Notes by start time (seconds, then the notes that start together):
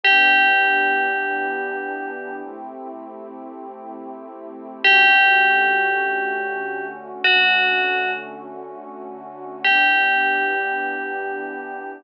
0.04 E3 B3 D4 G4
2.44 A3 C4 E4 G4
4.83 D3 A3 C#4 F#4 G4
7.24 D3 A3 C#4 F#4
9.64 E3 B3 D4 G4